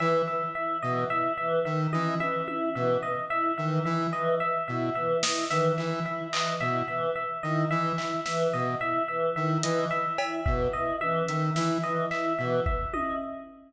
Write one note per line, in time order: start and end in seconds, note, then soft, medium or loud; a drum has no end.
0.00 0.22 E3 medium
0.00 0.22 E5 medium
0.00 cowbell medium
0.28 0.50 E5 medium
0.55 0.77 E4 medium
0.55 0.77 E5 medium
0.82 1.05 B2 medium
0.82 1.05 E3 medium
0.82 1.04 D#5 medium
1.10 1.32 E4 medium
1.10 1.32 E5 medium
1.38 1.60 E3 medium
1.38 1.60 E5 medium
1.65 1.87 D#3 medium
1.65 1.87 E5 medium
1.93 2.15 E3 medium
1.93 2.15 E4 medium
1.93 2.15 D#5 medium
1.93 high tom medium
2.20 2.42 E3 medium
2.20 2.42 E5 medium
2.20 high tom soft
2.47 2.69 E4 medium
2.47 2.70 E5 medium
2.47 high tom medium
2.75 2.97 B2 medium
2.75 2.97 E3 medium
2.75 2.97 E5 medium
3.03 3.25 D#5 medium
3.30 3.52 E4 medium
3.30 3.52 E5 medium
3.58 3.80 D#3 medium
3.58 3.80 E3 medium
3.58 3.80 E5 medium
3.85 4.07 E3 medium
3.85 4.07 E4 medium
3.85 4.07 E5 medium
4.13 4.35 E3 medium
4.13 4.35 D#5 medium
4.40 4.62 E5 medium
4.68 4.90 B2 medium
4.68 4.90 E4 medium
4.68 4.90 E5 medium
4.95 5.17 E3 medium
4.95 5.17 E5 medium
5.23 5.45 E4 medium
5.23 5.45 D#5 medium
5.23 snare loud
5.50 5.72 D#3 medium
5.50 5.73 E3 medium
5.50 5.72 E5 medium
5.50 snare medium
5.78 6.00 E3 medium
5.78 6.00 E5 medium
5.78 clap medium
6.06 6.28 E4 medium
6.06 6.28 E5 medium
6.33 6.55 E3 medium
6.33 6.55 D#5 medium
6.33 clap loud
6.61 6.83 B2 medium
6.61 6.83 E4 medium
6.61 6.83 E5 medium
6.88 7.10 E3 medium
6.88 7.10 E5 medium
7.15 7.38 E5 medium
7.43 7.65 D#3 medium
7.43 7.65 E4 medium
7.43 7.65 D#5 medium
7.71 7.93 E3 medium
7.71 7.93 E5 medium
7.98 8.20 E4 medium
7.98 8.20 E5 medium
7.98 clap medium
8.26 8.48 E3 medium
8.26 8.48 E5 medium
8.26 snare medium
8.53 8.75 B2 medium
8.53 8.75 D#5 medium
8.81 9.03 E4 medium
8.81 9.03 E5 medium
9.08 9.30 E3 medium
9.08 9.30 E5 medium
9.36 9.58 D#3 medium
9.36 9.58 E4 medium
9.36 9.58 E5 medium
9.63 9.86 E3 medium
9.63 9.85 D#5 medium
9.63 closed hi-hat loud
9.91 10.13 E5 medium
10.18 10.41 E4 medium
10.18 10.40 E5 medium
10.18 cowbell loud
10.46 10.68 B2 medium
10.46 10.68 E3 medium
10.46 10.68 E5 medium
10.46 kick medium
10.73 10.96 E4 medium
10.73 10.95 D#5 medium
11.01 11.23 E3 medium
11.01 11.23 E5 medium
11.01 high tom soft
11.28 11.50 D#3 medium
11.28 11.51 E5 medium
11.28 closed hi-hat medium
11.56 11.78 E3 medium
11.56 11.78 E4 medium
11.56 11.78 E5 medium
11.56 snare medium
11.83 12.06 E3 medium
11.83 12.06 D#5 medium
12.11 12.33 E4 medium
12.11 12.33 E5 medium
12.11 clap medium
12.38 12.60 B2 medium
12.38 12.61 E3 medium
12.38 12.61 E5 medium
12.66 12.88 E5 medium
12.66 kick medium
12.93 13.15 E4 medium
12.93 13.15 D#5 medium
12.93 high tom medium